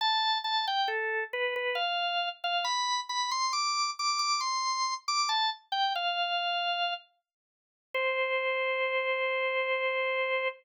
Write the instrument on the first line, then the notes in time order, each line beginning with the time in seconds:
drawbar organ
0.01 A5
0.44 A5
0.67 G5
0.88 A4
1.33 B4
1.56 B4
1.75 F5
2.44 F5
2.65 B5
3.09 B5
3.31 C6
3.53 D6
3.99 D6
4.19 D6
4.41 C6
5.08 D6
5.29 A5
5.72 G5
5.95 F5
7.94 C5